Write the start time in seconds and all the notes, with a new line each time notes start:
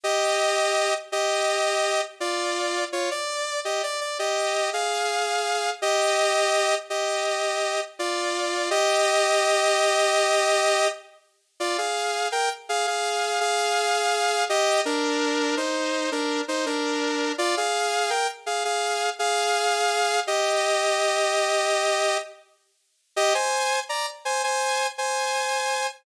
0.04 G4 D#5
1.12 G4 D#5
2.20 F4 D5
2.92 F4 C#5
3.11 D5
3.65 G4 D#5
3.83 D5
4.01 D5
4.19 G4 D#5
4.73 G#4 F5
5.82 G4 D#5
6.90 G4 D#5
7.99 F4 D5
8.70 G4 D#5
11.60 F4 D5
11.78 G#4 F5
12.32 A#4 G5
12.69 G#4 F5
12.87 G#4 F5
13.40 G#4 F5
14.49 G4 D#5
14.85 D4 A#4
15.57 D#4 C5
16.12 D4 A#4
16.48 D#4 C5
16.66 D4 A#4
17.38 F4 D5
17.57 G#4 F5
18.10 A#4 G5
18.46 G#4 F5
18.65 G#4 F5
19.19 G#4 F5
20.27 G4 D#5
23.16 G4 D#5
23.34 C5 G#5
23.89 D5 A#5
24.25 C5 G#5
24.44 C5 G#5
24.98 C5 G#5